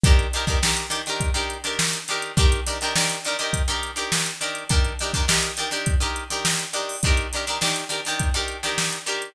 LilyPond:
<<
  \new Staff \with { instrumentName = "Acoustic Guitar (steel)" } { \time 4/4 \key ees \mixolydian \tempo 4 = 103 <ees d' g' bes'>8 <ees d' g' bes'>16 <ees d' g' bes'>16 <ees d' g' bes'>8 <ees d' g' bes'>16 <ees d' g' bes'>8 <ees d' g' bes'>8 <ees d' g' bes'>8. <ees d' g' bes'>8 | <ees d' g' bes'>8 <ees d' g' bes'>16 <ees d' g' bes'>16 <ees d' g' bes'>8 <ees d' g' bes'>16 <ees d' g' bes'>8 <ees d' g' bes'>8 <ees d' g' bes'>8. <ees d' g' bes'>8 | <ees d' g' bes'>8 <ees d' g' bes'>16 <ees d' g' bes'>16 <ees d' g' bes'>8 <ees d' g' bes'>16 <ees d' g' bes'>8 <ees d' g' bes'>8 <ees d' g' bes'>8. <ees d' g' bes'>8 | <ees d' g' bes'>8 <ees d' g' bes'>16 <ees d' g' bes'>16 <ees d' g' bes'>8 <ees d' g' bes'>16 <ees d' g' bes'>8 <ees d' g' bes'>8 <ees d' g' bes'>8. <ees d' g' bes'>8 | }
  \new DrumStaff \with { instrumentName = "Drums" } \drummode { \time 4/4 <hh bd>16 hh16 hh16 <hh bd>16 sn16 hh16 hh16 hh16 <hh bd>16 hh16 hh16 hh16 sn16 hh16 hh16 hh16 | <hh bd>16 hh16 hh16 hh16 sn16 <hh sn>16 hh16 hh16 <hh bd>16 hh16 hh16 hh16 sn16 hh16 hh16 hh16 | <hh bd>16 hh16 hh16 <hh bd>16 sn16 hh16 <hh sn>16 hh16 <hh bd>16 hh16 hh16 hh16 sn16 hh16 hh16 hho16 | <hh bd>16 hh16 hh16 hh16 sn16 hh16 hh16 <hh sn>16 <hh bd>16 hh16 hh16 <hh sn>16 sn16 hh16 hh16 hh16 | }
>>